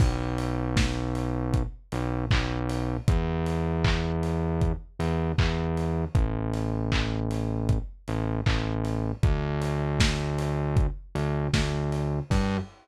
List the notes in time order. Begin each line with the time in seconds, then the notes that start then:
0.00 B1, kick, crash
0.38 open hi-hat
0.77 kick, snare
1.15 open hi-hat
1.54 kick, closed hi-hat
1.92 B1, open hi-hat
2.31 B1, kick, clap
2.69 open hi-hat
3.08 E2, kick, closed hi-hat
3.46 open hi-hat
3.84 kick, clap
4.23 open hi-hat
4.61 kick, closed hi-hat
4.99 E2, open hi-hat
5.38 E2, kick, clap
5.77 open hi-hat
6.15 A1, kick, closed hi-hat
6.54 open hi-hat
6.92 kick, clap
7.31 open hi-hat
7.69 kick, closed hi-hat
8.08 A1, open hi-hat
8.46 A1, kick, clap
8.85 open hi-hat
9.23 D2, kick, closed hi-hat
9.62 open hi-hat
10.00 kick, snare
10.38 open hi-hat
10.77 kick, closed hi-hat
11.15 D2, open hi-hat
11.54 D2, kick, snare
11.92 open hi-hat
12.30 G2, kick, crash